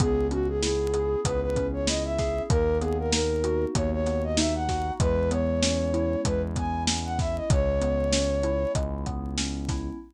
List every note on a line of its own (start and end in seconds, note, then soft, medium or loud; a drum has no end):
0.00 1.16 C#2 loud
0.00 1.25 B3 medium
0.00 0.27 G#4 medium
0.00 kick medium
0.00 closed hi-hat medium
0.31 1.56 C#4 medium
0.31 0.48 F#4 medium
0.31 closed hi-hat medium
0.48 0.62 G#4 medium
0.62 1.87 E4 medium
0.62 1.20 G#4 medium
0.62 snare medium
0.94 2.18 G#4 medium
0.94 closed hi-hat medium
1.25 2.41 C#2 medium
1.25 2.45 B3 medium
1.25 1.41 B4 medium
1.25 kick medium
1.25 closed hi-hat loud
1.42 1.67 B4 medium
1.56 2.46 C#4 medium
1.56 kick medium
1.56 closed hi-hat medium
1.73 1.87 C#5 medium
1.87 2.47 E4 medium
1.87 2.03 D#5 medium
1.87 snare medium
2.05 2.42 E5 medium
2.18 2.49 G#4 medium
2.18 kick medium
2.18 snare soft
2.18 closed hi-hat medium
2.50 3.66 D#2 loud
2.50 3.74 A#3 medium
2.50 2.78 A#4 medium
2.50 kick medium
2.50 closed hi-hat medium
2.81 4.06 B3 medium
2.81 2.97 G#4 medium
2.81 closed hi-hat medium
2.99 3.12 A#4 medium
3.12 4.37 D#4 medium
3.12 3.65 A#4 medium
3.12 snare medium
3.44 4.68 F#4 medium
3.44 closed hi-hat medium
3.74 4.91 D#2 loud
3.74 4.94 A#3 medium
3.74 3.90 C#5 medium
3.74 kick medium
3.74 closed hi-hat medium
3.92 4.23 C#5 medium
4.06 4.96 B3 medium
4.06 snare soft
4.06 closed hi-hat medium
4.24 4.37 D#5 medium
4.37 4.97 D#4 medium
4.37 4.54 E5 medium
4.37 snare medium
4.55 4.92 F#5 medium
4.68 4.99 F#4 medium
4.68 kick medium
4.68 snare medium
4.68 closed hi-hat medium
5.00 6.16 E2 loud
5.00 6.24 G#3 medium
5.00 5.30 B4 medium
5.00 kick medium
5.00 closed hi-hat medium
5.31 6.56 B3 medium
5.31 6.21 C#5 medium
5.31 closed hi-hat medium
5.62 6.87 C#4 medium
5.62 snare medium
5.94 7.19 E4 medium
5.94 closed hi-hat medium
6.25 7.41 E2 medium
6.25 7.44 G#3 medium
6.25 6.42 B4 medium
6.25 kick medium
6.25 closed hi-hat medium
6.56 7.46 B3 medium
6.56 6.83 G#5 medium
6.56 kick medium
6.56 closed hi-hat medium
6.87 7.47 C#4 medium
6.87 snare medium
7.05 7.18 F#5 medium
7.19 7.49 E4 medium
7.19 7.36 E5 medium
7.19 kick medium
7.19 snare soft
7.19 closed hi-hat medium
7.36 7.49 D#5 medium
7.50 8.66 C#2 loud
7.50 8.74 G#3 medium
7.50 8.72 C#5 medium
7.50 kick loud
7.50 closed hi-hat medium
7.81 9.06 B3 medium
7.81 closed hi-hat medium
8.13 9.37 C#4 medium
8.13 snare medium
8.43 9.69 E4 medium
8.43 closed hi-hat medium
8.75 9.91 C#2 medium
8.75 9.94 G#3 medium
8.75 kick medium
8.75 closed hi-hat medium
9.06 9.96 B3 medium
9.06 kick medium
9.06 closed hi-hat medium
9.38 9.97 C#4 medium
9.38 snare medium
9.69 9.99 E4 medium
9.69 kick medium
9.69 snare soft
9.69 closed hi-hat medium